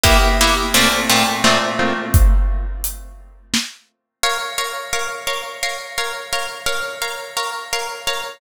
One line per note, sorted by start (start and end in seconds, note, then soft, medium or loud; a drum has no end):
0.04 0.17 A#3 loud
0.04 0.17 B3 medium
0.04 0.17 E4 loud
0.04 0.17 G4 loud
0.04 kick loud
0.04 closed hi-hat loud
0.41 0.55 A#3 medium
0.41 0.55 B3 medium
0.41 0.55 E4 medium
0.41 0.55 G4 medium
0.74 0.88 A#2 loud
0.74 0.88 A3 loud
0.74 0.88 C4 loud
0.74 0.88 F4 loud
0.74 closed hi-hat medium
1.10 1.24 A#2 medium
1.10 1.24 A3 medium
1.10 1.24 C4 medium
1.10 1.24 F4 medium
1.44 1.58 A#2 medium
1.44 1.58 A3 medium
1.44 1.58 C4 medium
1.44 1.58 F4 medium
1.44 snare loud
1.79 1.93 A#2 medium
1.79 1.93 A3 medium
1.79 1.93 C4 medium
1.79 1.93 F4 loud
2.14 kick loud
2.14 closed hi-hat loud
2.84 closed hi-hat loud
3.54 snare loud
4.23 4.37 A#4 medium
4.23 4.37 C#5 medium
4.23 4.37 F5 medium
4.58 4.72 A#4 medium
4.58 4.72 C#5 medium
4.58 4.72 F5 medium
4.93 5.07 A#4 medium
4.93 5.07 C#5 medium
4.93 5.07 F5 medium
5.27 5.41 A#4 medium
5.27 5.41 C#5 medium
5.27 5.41 F5 medium
5.63 5.77 A#4 medium
5.63 5.77 C#5 medium
5.63 5.77 F5 medium
5.98 6.12 A#4 medium
5.98 6.12 C#5 medium
5.98 6.12 F5 medium
6.33 6.47 A#4 medium
6.33 6.47 C#5 medium
6.33 6.47 F5 medium
6.66 6.80 A#4 medium
6.66 6.80 C#5 medium
6.66 6.80 F5 medium
7.02 7.16 A#4 medium
7.02 7.16 C#5 medium
7.02 7.16 F5 medium
7.37 7.51 A#4 medium
7.37 7.51 C#5 medium
7.37 7.51 F5 medium
7.73 7.87 A#4 medium
7.73 7.87 C#5 medium
7.73 7.87 F5 medium
8.07 8.21 A#4 medium
8.07 8.21 C#5 medium
8.07 8.21 F5 medium